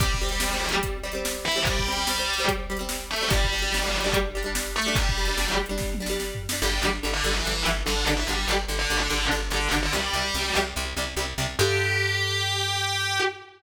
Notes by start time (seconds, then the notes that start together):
0.00 C2 G3 C4 G4, kick, closed hi-hat
0.14 kick
0.21 G3 C4
0.29 G3 C4, closed hi-hat
0.40 G3 C4, snare
0.51 G3 C4
0.69 G3, closed hi-hat
0.74 C4
0.83 kick, closed hi-hat
1.03 G3 C4
1.12 G3 C4, closed hi-hat
1.25 snare
1.45 E3 E4
1.52 closed hi-hat
1.56 G3 C4
1.65 C2 G3 G4, kick, closed hi-hat
1.79 kick
1.86 G3 C4
1.92 closed hi-hat
1.96 G3 C4
2.07 G3 C4, snare
2.18 G3 C4
2.34 closed hi-hat
2.38 G3 C4
2.48 kick, closed hi-hat
2.70 G3 C4
2.77 G3, closed hi-hat
2.81 C4
2.89 snare
3.11 A3 A4
3.16 closed hi-hat
3.21 G3 C4
3.30 G1 G3 D4 G4, kick, closed hi-hat
3.44 kick
3.52 G3 D4
3.58 G3, closed hi-hat
3.64 D4
3.72 G3 D4, snare
3.82 G3 D4
4.00 G3, closed hi-hat
4.06 D4
4.13 kick, closed hi-hat
4.35 G3 D4
4.43 G3 D4, closed hi-hat
4.55 snare
4.76 A3 A4
4.82 closed hi-hat
4.86 G3 D4
4.95 G1 G3 G4, kick, closed hi-hat
5.09 kick
5.18 G3 D4
5.25 G3, closed hi-hat
5.29 D4
5.37 G3 D4, snare
5.48 G3 D4
5.66 G3, closed hi-hat
5.71 D4
5.78 kick, snare
5.94 high tom
6.00 G3 D4
6.06 G3, snare
6.11 D4
6.20 snare
6.35 floor tom
6.49 G3, snare
6.53 D4
6.62 G1 D3 G3 G4
6.82 G1 D3 G3
7.03 G1 D3 G3
7.13 D3 D4
7.24 G1 D3 G3
7.35 E3 E4
7.45 G1 D3 G3
7.65 G1 D3 G3
7.86 G1 D3 G3 D4
8.06 G1 D3 G3
8.17 E3 E4
8.27 G1 D3 G3 G4
8.48 G1 D3 G3
8.68 G1 D3 G3
8.79 D3 D4
8.90 G1 D3 G3
9.00 D3 D4
9.10 G1 D3 G3
9.31 G1 D3 G3
9.50 G1 D3 G3 D4
9.71 G1 D3 G3
9.83 D3 D4
9.92 C2 C3 G3 G4
10.13 C2 C3 G3
10.34 C2 C3 G3
10.55 C2 C3 G3
10.76 C2 C3 G3
10.97 C2 C3 G3
11.17 C2 C3 G3
11.38 C2 C3 G3
11.59 G2 D3 G3 G4